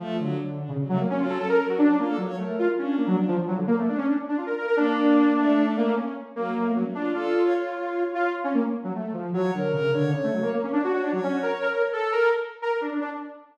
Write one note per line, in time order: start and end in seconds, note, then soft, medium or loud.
0.00 0.18 F3 medium
0.00 0.16 A3 loud
0.19 0.64 D3 medium
0.19 0.38 F#3 medium
0.61 0.70 D4 medium
0.69 0.78 C#3 medium
0.79 0.88 F#3 medium
0.89 0.98 F#3 loud
0.89 0.99 A3 loud
1.00 1.08 A#3 medium
1.09 1.18 F#3 medium
1.09 1.19 C#4 loud
1.20 1.38 F#3 loud
1.20 1.28 F4 medium
1.29 1.38 A4 medium
1.38 1.56 C#4 medium
1.38 1.49 A4 loud
1.49 1.58 A#4 medium
1.59 1.87 F#3 medium
1.59 1.67 A#4 medium
1.69 1.78 F#4 medium
1.78 1.96 D4 loud
1.88 1.97 C#4 medium
1.99 2.16 A#3 medium
1.99 2.08 F4 medium
2.08 2.17 A4 loud
2.17 2.35 F#3 medium
2.17 2.26 C#5 medium
2.27 2.36 C#5 loud
2.38 2.56 A3 medium
2.38 2.74 A#4 medium
2.59 2.68 F4 loud
2.78 2.96 C#4 medium
2.78 3.33 D4 medium
2.97 3.06 A#3 medium
3.07 3.16 F#3 loud
3.28 3.37 F3 loud
3.38 3.47 F3 medium
3.48 3.56 F#3 loud
3.57 3.66 D3 medium
3.67 3.76 A#3 loud
3.78 3.87 A3 medium
3.88 3.97 D4 medium
3.97 4.06 C#4 loud
4.07 4.16 D4 medium
4.28 4.37 D4 medium
4.37 4.46 F4 medium
4.46 4.55 A#4 medium
4.57 4.66 A#4 medium
4.67 4.76 A#4 loud
4.77 5.30 A#3 loud
4.77 5.66 D4 loud
5.37 5.91 A3 loud
5.77 5.95 A#3 loud
5.96 6.14 C#4 medium
6.36 6.54 F#3 medium
6.36 6.72 A#3 loud
6.57 6.75 A3 medium
6.74 6.84 F#3 medium
6.74 6.83 C#4 medium
6.86 6.95 A3 medium
6.95 7.13 D4 medium
6.95 7.13 F4 medium
7.14 8.04 F4 medium
7.14 7.42 A4 loud
7.44 7.53 C#5 loud
7.55 7.73 C#5 medium
7.73 8.27 C#5 medium
8.15 8.33 F4 loud
8.44 8.53 C#4 loud
8.54 8.63 A#3 medium
8.84 8.93 F#3 medium
8.95 9.13 A3 medium
9.13 9.31 F3 medium
9.34 9.51 F#3 loud
9.34 9.52 C#5 loud
9.54 9.72 D3 medium
9.54 9.72 A#4 medium
9.73 9.91 C#3 medium
9.73 9.91 A#4 loud
9.93 10.11 D3 medium
9.93 10.11 C#5 loud
10.13 10.22 C#3 medium
10.13 10.50 C#5 loud
10.24 10.33 A3 medium
10.33 10.42 F#3 medium
10.42 10.51 A#3 medium
10.53 10.62 A#3 medium
10.63 10.72 C#4 medium
10.72 10.81 D4 loud
10.72 10.90 C#5 medium
10.84 10.92 F#4 medium
10.93 11.02 F#4 loud
10.93 11.11 C#5 medium
11.03 11.12 D4 loud
11.12 11.21 F#3 loud
11.12 11.67 C#5 loud
11.23 11.32 C#4 loud
11.32 11.41 F#4 medium
11.43 11.51 A#4 medium
11.62 11.71 A#4 loud
11.72 11.82 A#4 medium
11.72 11.90 C#5 medium
11.93 12.11 A4 loud
11.93 12.29 A4 loud
12.12 12.30 A#4 loud
12.62 12.71 A#4 loud
12.72 12.81 A#4 medium
12.81 12.90 D4 medium
12.92 13.00 D4 medium
13.01 13.10 D4 loud